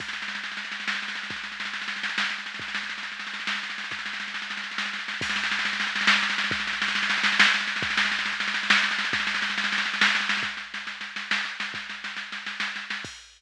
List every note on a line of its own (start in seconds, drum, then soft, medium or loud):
0.00 kick medium
0.00 snare medium
0.00 crash medium
0.08 snare medium
0.13 snare medium
0.22 snare medium
0.28 snare medium
0.35 snare medium
0.44 snare medium
0.52 snare medium
0.57 snare medium
0.65 snare medium
0.72 snare medium
0.80 snare medium
0.88 snare medium
0.95 snare medium
1.02 snare medium
1.08 snare medium
1.15 snare medium
1.23 snare medium
1.30 kick loud
1.30 snare medium
1.36 snare medium
1.44 snare medium
1.52 snare medium
1.60 snare medium
1.65 snare medium
1.73 snare medium
1.82 snare medium
1.88 snare medium
1.96 snare medium
2.03 snare medium
2.09 snare medium
2.18 snare loud
2.24 snare medium
2.30 snare medium
2.38 snare medium
2.46 snare medium
2.54 snare medium
2.59 kick loud
2.59 snare medium
2.68 snare medium
2.75 snare medium
2.83 snare medium
2.89 snare medium
2.98 snare medium
3.03 snare medium
3.12 snare medium
3.19 snare medium
3.27 snare medium
3.34 snare medium
3.40 snare medium
3.47 snare loud
3.55 snare medium
3.63 snare medium
3.70 snare medium
3.78 snare medium
3.84 snare medium
3.91 kick medium
3.91 snare medium
3.99 snare medium
4.06 snare medium
4.13 snare medium
4.20 snare medium
4.28 snare medium
4.34 snare medium
4.42 snare medium
4.50 snare medium
4.57 snare medium
4.64 snare medium
4.71 snare medium
4.78 snare medium
4.86 snare medium
4.93 snare medium
4.99 snare medium
5.08 snare medium
5.14 snare medium
5.21 kick loud
5.21 snare medium
5.21 crash loud
5.29 snare medium
5.36 snare medium
5.44 snare medium
5.51 snare medium
5.59 snare medium
5.65 snare medium
5.73 snare medium
5.80 snare medium
5.87 snare medium
5.95 snare medium
6.01 snare medium
6.07 snare loud
6.16 snare medium
6.23 snare medium
6.30 snare medium
6.38 snare medium
6.44 snare medium
6.51 kick loud
6.51 snare medium
6.60 snare medium
6.67 snare medium
6.73 snare medium
6.82 snare loud
6.88 snare medium
6.95 snare medium
7.03 snare medium
7.10 snare loud
7.18 snare medium
7.23 snare loud
7.32 snare medium
7.39 snare loud
7.47 snare medium
7.54 snare medium
7.61 snare medium
7.67 snare medium
7.76 snare medium
7.82 kick loud
7.82 snare medium
7.90 snare medium
7.97 snare loud
8.05 snare medium
8.12 snare medium
8.19 snare medium
8.26 snare medium
8.33 snare medium
8.40 snare medium
8.48 snare medium
8.54 snare medium
8.63 snare medium
8.70 snare loud
8.77 snare medium
8.83 snare medium
8.91 snare medium
8.98 snare medium
9.05 snare medium
9.13 kick loud
9.13 snare loud
9.20 snare medium
9.27 snare medium
9.34 snare medium
9.42 snare medium
9.50 snare medium
9.58 snare loud
9.64 snare medium
9.72 snare medium
9.78 snare medium
9.86 snare medium
9.94 snare medium
10.01 snare loud
10.08 snare medium
10.15 snare medium
10.20 snare medium
10.29 snare loud
10.37 snare medium
10.43 kick loud
10.43 snare medium
10.57 snare medium
10.74 snare medium
10.87 snare medium
11.01 snare medium
11.16 snare medium
11.31 snare loud
11.45 snare medium
11.60 snare medium
11.74 kick medium
11.74 snare medium
11.89 snare medium
12.04 snare medium
12.17 snare medium
12.32 snare medium
12.46 snare medium
12.60 snare medium
12.76 snare medium
12.90 snare medium
13.05 kick loud
13.05 crash loud